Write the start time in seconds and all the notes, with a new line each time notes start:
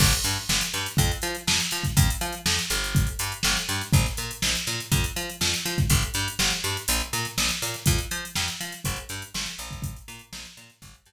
0.00 G1, kick, crash
0.13 closed hi-hat
0.24 G2, snare, closed hi-hat
0.49 G1, snare
0.61 closed hi-hat
0.74 G2, snare, closed hi-hat
0.86 closed hi-hat
0.97 F2, kick, closed hi-hat
1.11 closed hi-hat
1.22 F3, snare, closed hi-hat
1.35 closed hi-hat
1.47 F2, snare
1.60 closed hi-hat
1.71 F3, closed hi-hat
1.83 kick, closed hi-hat
1.97 F2, kick, closed hi-hat
2.10 closed hi-hat
2.21 F3, closed hi-hat
2.32 closed hi-hat
2.46 F2, snare
2.59 closed hi-hat
2.70 G1, closed hi-hat
2.84 closed hi-hat
2.95 kick, closed hi-hat
3.07 closed hi-hat
3.19 G2, closed hi-hat
3.32 closed hi-hat
3.43 G1, snare
3.56 snare, closed hi-hat
3.69 G2, closed hi-hat
3.81 closed hi-hat
3.93 A#1, kick, closed hi-hat
4.06 snare, closed hi-hat
4.17 A#2, closed hi-hat
4.31 closed hi-hat
4.42 A#1, snare
4.55 closed hi-hat
4.67 A#2, closed hi-hat
4.80 closed hi-hat
4.92 F2, kick, closed hi-hat
5.04 closed hi-hat
5.16 F3, closed hi-hat
5.30 closed hi-hat
5.41 F2, snare
5.54 closed hi-hat
5.65 F3, snare, closed hi-hat
5.78 kick, closed hi-hat
5.90 G1, kick, closed hi-hat
6.02 closed hi-hat
6.14 G2, closed hi-hat
6.28 closed hi-hat
6.39 G1, snare
6.50 closed hi-hat
6.64 G2, closed hi-hat
6.77 closed hi-hat
6.88 A#1, closed hi-hat
7.00 closed hi-hat
7.13 A#2, closed hi-hat
7.25 snare, closed hi-hat
7.38 A#1, snare
7.49 snare, closed hi-hat
7.62 A#2, closed hi-hat
7.74 snare, closed hi-hat
7.86 F2, kick, closed hi-hat
7.98 closed hi-hat
8.11 F3, closed hi-hat
8.25 closed hi-hat
8.35 F2, snare
8.48 closed hi-hat
8.60 F3, closed hi-hat
8.72 closed hi-hat
8.84 G1, kick, closed hi-hat
8.96 closed hi-hat
9.09 G2, closed hi-hat
9.22 closed hi-hat
9.34 G1, snare
9.46 closed hi-hat
9.59 A#1, closed hi-hat
9.71 kick, closed hi-hat
9.82 kick, closed hi-hat
9.96 closed hi-hat
10.08 A#2, closed hi-hat
10.19 closed hi-hat
10.33 A#1, snare
10.45 closed hi-hat
10.57 A#2, closed hi-hat
10.70 closed hi-hat
10.82 G1, kick, closed hi-hat
10.94 closed hi-hat
11.06 G2, closed hi-hat